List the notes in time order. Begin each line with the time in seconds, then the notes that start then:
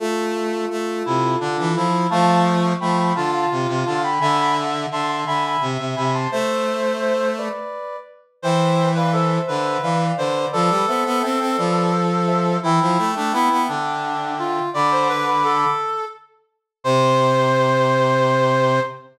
0.00 A3 F4 A4
0.70 A3
1.05 C3 E4
1.40 D3 D4
1.59 E3
1.75 F3 E4
2.10 F3 A3 F5 A5
2.28 F5 A5
2.80 F3 A3 G5 B5
2.97 G5 B5
3.15 D3 F4 F5 A5
3.32 F5 A5
3.51 C3
3.68 C3
3.86 D3 F5 A5
4.03 G5 B5
4.20 D3 E5 G#5 B5
4.38 G#5 B5
4.91 D3 E5 A5 C6
5.08 A5 C6
5.26 D3 E5 G#5 B5
5.46 G#5 B5
5.61 C3
5.79 C3
5.96 C3 G#5 B5
6.14 A5 C6
6.31 A3 C5 E5
7.01 C5 E5
7.38 B4 D5
8.42 E3 C5 E5 G5
8.95 B4 D5 F5
9.12 A4 C5 E5
9.47 D3 B4
9.82 E3 D5 F5
10.18 D3 B4 C5 D5
10.52 F3 A4 B4 D5
10.69 G3
10.87 B3 C5 E5
11.06 B3
11.22 C4 E5 G5
11.40 C4
11.57 F3 B4 D5
12.27 C5 E5
12.63 E3 E4 E5 G5
12.81 F3
12.98 A3
13.16 A3 D4
13.32 B3 E4
13.51 B3
13.68 D3 D4
14.38 F4
14.74 D3 D5 B5 D6
14.91 C5
15.09 B4
15.26 B4
15.44 A4
16.84 C3 C5 C6